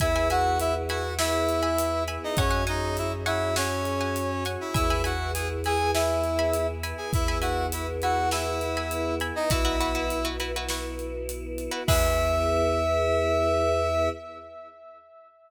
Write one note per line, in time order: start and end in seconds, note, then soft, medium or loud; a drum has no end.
0.00 2.18 E2 medium
0.00 2.34 B3 medium
0.00 2.34 E4 medium
0.00 0.28 E4 medium
0.00 2.34 G#4 medium
0.00 0.28 E5 medium
0.00 0.13 E5 loud
0.00 0.13 G#5 loud
0.00 0.13 B5 medium
0.00 kick medium
0.00 closed hi-hat medium
0.16 0.27 E5 loud
0.16 0.27 G#5 loud
0.16 0.27 B5 loud
0.30 0.58 F#4 medium
0.30 0.78 E5 loud
0.30 0.58 F#5 medium
0.30 0.78 G#5 loud
0.30 0.78 B5 loud
0.30 closed hi-hat medium
0.60 0.74 E4 medium
0.60 0.74 E5 medium
0.60 closed hi-hat medium
0.88 1.13 F#4 medium
0.88 1.13 E5 medium
0.88 1.13 F#5 medium
0.88 1.13 G#5 loud
0.88 1.13 B5 loud
0.88 closed hi-hat medium
1.19 2.03 E4 medium
1.19 2.03 E5 medium
1.19 1.54 E5 loud
1.19 1.54 G#5 medium
1.19 1.54 B5 medium
1.19 snare loud
1.49 closed hi-hat medium
1.63 1.98 E5 loud
1.63 1.98 G#5 medium
1.63 1.98 B5 medium
1.78 closed hi-hat loud
2.08 2.32 E5 medium
2.08 2.32 G#5 medium
2.08 2.32 B5 loud
2.08 closed hi-hat medium
2.24 2.38 D#4 medium
2.24 2.38 D#5 medium
2.37 4.57 F#2 loud
2.37 4.72 C#4 medium
2.37 2.64 C#4 medium
2.37 4.72 F#4 medium
2.37 4.72 G#4 medium
2.37 2.64 C#5 medium
2.37 2.50 F#5 loud
2.37 2.50 G#5 loud
2.37 2.50 C#6 loud
2.37 kick loud
2.37 closed hi-hat medium
2.51 2.62 F#5 loud
2.51 2.62 G#5 loud
2.51 2.62 C#6 loud
2.67 2.97 D#4 medium
2.67 2.97 D#5 medium
2.67 3.14 F#5 medium
2.67 3.14 G#5 loud
2.67 3.14 C#6 medium
2.67 closed hi-hat medium
2.97 3.12 E4 medium
2.97 3.12 E5 medium
2.97 closed hi-hat medium
3.26 3.55 E4 medium
3.26 3.55 E5 medium
3.26 3.50 F#5 loud
3.26 3.50 G#5 medium
3.26 3.50 C#6 loud
3.26 closed hi-hat medium
3.56 4.44 C#4 medium
3.56 4.44 C#5 medium
3.56 3.92 F#5 loud
3.56 3.92 G#5 loud
3.56 3.92 C#6 medium
3.56 snare loud
3.85 closed hi-hat medium
4.01 4.36 F#5 medium
4.01 4.36 G#5 loud
4.01 4.36 C#6 medium
4.16 closed hi-hat medium
4.45 4.69 F#5 loud
4.45 4.69 G#5 medium
4.45 4.69 C#6 medium
4.45 closed hi-hat medium
4.61 4.74 E4 medium
4.61 4.74 E5 medium
4.74 6.94 E2 loud
4.74 7.11 B3 medium
4.74 5.01 E4 medium
4.74 7.11 E4 medium
4.74 7.11 G#4 medium
4.74 4.86 E5 loud
4.74 5.01 E5 medium
4.74 4.86 G#5 medium
4.74 4.86 B5 loud
4.74 kick loud
4.74 closed hi-hat medium
4.90 5.02 E5 medium
4.90 5.02 G#5 loud
4.90 5.02 B5 loud
5.04 5.31 F#4 medium
5.04 5.51 E5 medium
5.04 5.31 F#5 medium
5.04 5.51 G#5 medium
5.04 5.51 B5 loud
5.04 closed hi-hat medium
5.34 5.48 G#4 medium
5.34 5.48 G#5 medium
5.34 closed hi-hat loud
5.64 5.91 G#4 medium
5.64 5.89 E5 medium
5.64 5.91 G#5 medium
5.64 5.89 G#5 loud
5.64 5.89 B5 medium
5.64 closed hi-hat medium
5.94 6.67 E4 medium
5.94 6.67 E5 medium
5.94 6.31 E5 medium
5.94 6.31 G#5 loud
5.94 6.31 B5 loud
5.94 snare loud
6.24 closed hi-hat medium
6.39 6.74 E5 loud
6.39 6.74 G#5 loud
6.39 6.74 B5 loud
6.53 closed hi-hat medium
6.83 7.25 E5 loud
6.83 7.25 G#5 loud
6.83 7.25 B5 loud
6.83 closed hi-hat medium
6.97 7.11 G#4 medium
6.97 7.11 G#5 medium
7.13 9.32 E2 medium
7.13 9.49 B3 medium
7.13 7.38 E4 medium
7.13 9.49 E4 medium
7.13 9.49 G#4 medium
7.13 7.38 E5 medium
7.13 kick loud
7.13 closed hi-hat medium
7.28 7.40 E5 loud
7.28 7.40 G#5 medium
7.28 7.40 B5 loud
7.41 7.66 F#4 medium
7.41 7.89 E5 medium
7.41 7.66 F#5 medium
7.41 7.89 G#5 loud
7.41 7.89 B5 loud
7.41 closed hi-hat medium
7.72 7.87 E4 medium
7.72 7.87 E5 medium
7.72 closed hi-hat loud
8.02 8.29 F#4 medium
8.02 8.27 E5 medium
8.02 8.29 F#5 medium
8.02 8.27 G#5 medium
8.02 8.27 B5 medium
8.02 closed hi-hat medium
8.31 9.14 E4 medium
8.31 9.14 E5 medium
8.31 8.68 E5 medium
8.31 8.68 G#5 loud
8.31 8.68 B5 medium
8.31 snare medium
8.61 closed hi-hat medium
8.77 9.12 E5 medium
8.77 9.12 G#5 medium
8.77 9.12 B5 loud
8.91 closed hi-hat medium
9.20 9.45 E5 medium
9.20 9.45 G#5 loud
9.20 9.45 B5 loud
9.20 closed hi-hat medium
9.35 9.50 D#4 medium
9.35 9.50 D#5 medium
9.50 11.69 B1 loud
9.50 11.87 B3 medium
9.50 10.26 E4 medium
9.50 9.62 E4 loud
9.50 11.87 E4 medium
9.50 9.62 F#4 loud
9.50 11.87 F#4 medium
9.50 9.62 B4 loud
9.50 10.26 E5 medium
9.50 kick loud
9.50 closed hi-hat loud
9.65 9.77 E4 medium
9.65 9.77 F#4 medium
9.65 9.77 B4 medium
9.80 9.92 E4 loud
9.80 9.92 F#4 medium
9.80 9.92 B4 loud
9.80 closed hi-hat medium
9.95 10.19 E4 loud
9.95 10.19 F#4 medium
9.95 10.19 B4 medium
10.10 closed hi-hat medium
10.25 10.37 E4 loud
10.25 10.37 F#4 medium
10.25 10.37 B4 loud
10.40 10.52 E4 medium
10.40 10.52 F#4 medium
10.40 10.52 B4 loud
10.40 closed hi-hat medium
10.56 10.68 E4 loud
10.56 10.68 F#4 medium
10.56 10.68 B4 loud
10.69 11.17 E4 loud
10.69 11.17 F#4 loud
10.69 11.17 B4 medium
10.69 snare medium
10.99 closed hi-hat medium
11.29 closed hi-hat medium
11.58 closed hi-hat medium
11.71 11.83 E4 medium
11.71 11.83 F#4 loud
11.71 11.83 B4 loud
11.87 14.09 E2 loud
11.87 14.09 B3 loud
11.87 14.09 E4 loud
11.87 14.10 E4 loud
11.87 14.09 G#4 loud
11.87 14.10 G#4 medium
11.87 14.10 B4 loud
11.87 14.09 E5 loud
11.87 kick loud
11.87 crash loud